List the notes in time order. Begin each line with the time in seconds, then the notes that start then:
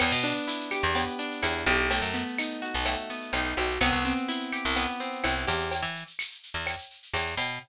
0.00 E2 B3, crash, cowbell, claves
0.12 B2, shaker
0.24 D4, shaker
0.35 shaker
0.48 E4, tambourine, shaker
0.60 shaker
0.71 G4, claves, shaker
0.83 E2, shaker
0.95 B3, cowbell, shaker
1.07 shaker
1.19 D4, shaker
1.31 shaker
1.42 E2 E4, tambourine, cowbell, claves, shaker
1.54 shaker
1.66 B1 G4, cowbell, shaker
1.79 shaker
1.90 A3, cowbell, shaker
2.02 F#2, shaker
2.14 B3, shaker
2.26 shaker
2.38 D#4, tambourine, claves, shaker
2.50 shaker
2.62 F#4, shaker
2.74 B1, shaker
2.85 A3, cowbell, claves, shaker
2.97 shaker
3.09 B3, shaker
3.22 shaker
3.33 B1 D#4, tambourine, cowbell, shaker
3.45 shaker
3.57 B1 F#4, cowbell, shaker
3.69 shaker
3.81 C2 B3, cowbell, claves, shaker
3.92 C2, shaker
4.04 C4, shaker
4.16 shaker
4.28 E4, tambourine, shaker
4.40 shaker
4.52 G4, claves, shaker
4.64 C2, shaker
4.76 B3, cowbell, shaker
4.89 shaker
5.00 C4, shaker
5.12 shaker
5.24 C2 E4, tambourine, cowbell, claves, shaker
5.36 shaker
5.47 E2 G4, cowbell, shaker
5.59 shaker
5.71 cowbell, shaker
5.82 E3, shaker
5.95 shaker
6.07 shaker
6.19 tambourine, claves, shaker
6.31 shaker
6.43 shaker
6.54 E2, shaker
6.66 cowbell, claves, shaker
6.78 shaker
6.90 shaker
7.02 shaker
7.13 E2, tambourine, cowbell, shaker
7.26 shaker
7.37 B2, cowbell, shaker
7.50 shaker